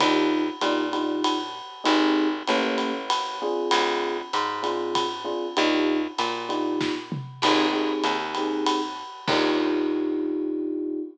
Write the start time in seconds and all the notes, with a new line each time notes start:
0.00 D#2 D4 D#4 F4 G4, kick, ride
0.61 A#2 D4 D#4 F4 G4, hi-hat pedal, ride
0.93 D4 D#4 F4 G4, ride
1.24 ride
1.84 G#1 C4 D#4 G4 G#4, ride
2.47 A1 A#3 C#4 G4 A4, hi-hat pedal, ride
2.78 ride
3.10 ride
3.42 C4 D4 F4 G#4
3.71 D2, ride
4.33 G#2, hi-hat pedal, ride
4.63 C4 D4 F4 G#4, ride
4.95 kick, ride
5.24 C4 D4 F4 G#4
5.57 D#2 D4 D#4 F4 G4, ride
6.18 A#2, hi-hat pedal, ride
6.49 D4 D#4 F4 G4, ride
6.81 kick, snare
7.12 mid tom
7.42 G#1 C4 D#4 G4 G#4, crash, ride
7.72 C4 D#4 G4 G#4
8.04 D#2, hi-hat pedal, ride
8.35 C4 D#4 G4 G#4, ride
8.66 ride
9.28 D#2 D4 D#4 F4 G4, kick, crash